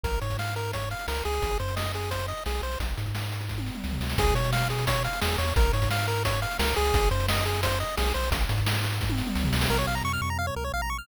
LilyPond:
<<
  \new Staff \with { instrumentName = "Lead 1 (square)" } { \time 4/4 \key des \major \tempo 4 = 174 bes'8 des''8 f''8 bes'8 des''8 f''8 bes'8 aes'8~ | aes'8 c''8 ees''8 aes'8 c''8 ees''8 aes'8 c''8 | r1 | aes'8 des''8 f''8 aes'8 des''8 f''8 aes'8 des''8 |
bes'8 des''8 f''8 bes'8 des''8 f''8 bes'8 aes'8~ | aes'8 c''8 ees''8 aes'8 c''8 ees''8 aes'8 c''8 | r1 | \key bes \minor bes'16 des''16 f''16 bes''16 des'''16 f'''16 des'''16 bes''16 f''16 des''16 bes'16 des''16 f''16 bes''16 des'''16 f'''16 | }
  \new Staff \with { instrumentName = "Synth Bass 1" } { \clef bass \time 4/4 \key des \major bes,,8 aes,2~ aes,8 des,8 des,8 | aes,,8 ges,2~ ges,8 b,,8 b,,8 | bes,,8 aes,2~ aes,8 des,8 des,8 | des,8 b,2~ b,8 e,8 e,8 |
bes,,8 aes,2~ aes,8 des,8 des,8 | aes,,8 ges,2~ ges,8 b,,8 b,,8 | bes,,8 aes,2~ aes,8 des,8 des,8 | \key bes \minor bes,,8 bes,,8 f,8 f,4 des,8 bes,,4 | }
  \new DrumStaff \with { instrumentName = "Drums" } \drummode { \time 4/4 <hh bd>16 hh16 hh16 <hh bd>16 sn16 hh16 hh16 hh16 <hh bd>16 hh16 hh16 hh16 sn16 hh16 hh16 hh16 | <hh bd>16 hh16 hh16 hh16 sn16 hh16 hh16 hh16 <hh bd>16 hh16 hh16 hh16 sn16 hh16 hh16 hh16 | <hh bd>16 hh16 hh16 <hh bd>16 sn16 hh16 hh16 hh16 <bd sn>16 tommh16 sn16 toml16 sn16 tomfh16 sn16 sn16 | <hh bd>16 hh16 hh16 hh16 sn16 hh16 hh16 hh16 <hh bd>16 hh16 hh16 hh16 sn16 hh16 hh16 hh16 |
<hh bd>16 hh16 hh16 <hh bd>16 sn16 hh16 hh16 hh16 <hh bd>16 hh16 hh16 hh16 sn16 hh16 hh16 hh16 | <hh bd>16 hh16 hh16 hh16 sn16 hh16 hh16 hh16 <hh bd>16 hh16 hh16 hh16 sn16 hh16 hh16 hh16 | <hh bd>16 hh16 hh16 <hh bd>16 sn16 hh16 hh16 hh16 <bd sn>16 tommh16 sn16 toml16 sn16 tomfh16 sn16 sn16 | r4 r4 r4 r4 | }
>>